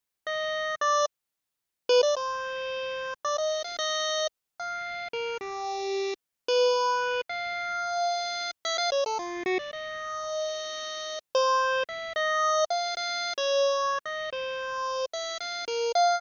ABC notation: X:1
M:6/4
L:1/16
Q:1/4=111
K:none
V:1 name="Lead 1 (square)"
z2 ^d4 =d2 z6 B d c8 | d ^d2 f d4 z2 f4 ^A2 G6 z2 | B6 f10 e f ^c A F2 ^F d | ^d12 c4 e2 d4 f2 |
f3 ^c5 ^d2 =c6 e2 f2 ^A2 f2 |]